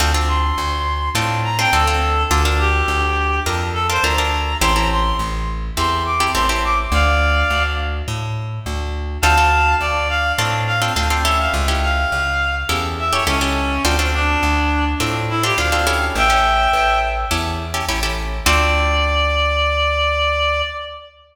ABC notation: X:1
M:4/4
L:1/16
Q:1/4=104
K:Dm
V:1 name="Clarinet"
z2 c'6 z2 b g A4 | z2 G6 z2 A c b4 | c' b c'2 z4 c'2 d'2 c' c' d' z | [df]6 z10 |
[fa]4 d2 f2 z2 f z3 e f | z2 f6 z2 e ^c ^C4 | z2 D6 z2 E G f4 | [eg]6 z10 |
d16 |]
V:2 name="Acoustic Guitar (steel)"
[CDFA] [CDFA]7 [CDFA]3 [CDFA] [CDFA] [CDFA]3 | [DFAB] [DFAB]7 [DFAB]3 [DFAB] [DFAB] [DFAB]3 | [CEGA] [CEGA]7 [CEGA]3 [CEGA] [CEGA] [CEGA]3 | z16 |
[CDFA] [CDFA]7 [CDFA]3 [CDFA] [CDFA] [CDFA] [^CEGA]2- | [^CEGA] [CEGA]7 [CEGA]3 [CEGA] [CEGA] [CEGA]3 | [CDFA] [CDFA]7 [CDFA]3 [CDFA] [CDFA] [CDFA] [^CEGA]2- | [^CEGA] [CEGA]7 [CEGA]3 [CEGA] [CEGA] [CEGA]3 |
[CDFA]16 |]
V:3 name="Electric Bass (finger)" clef=bass
D,,4 D,,4 A,,4 D,,4 | D,,4 D,,4 F,,4 D,,4 | A,,,4 A,,,4 E,,4 A,,,4 | D,,4 D,,4 A,,4 D,,4 |
D,,4 D,,4 A,,4 D,,4 | ^C,,4 C,,4 E,,4 C,,4 | D,,4 D,,4 A,,4 D,,4 | A,,,4 A,,,4 E,,4 A,,,4 |
D,,16 |]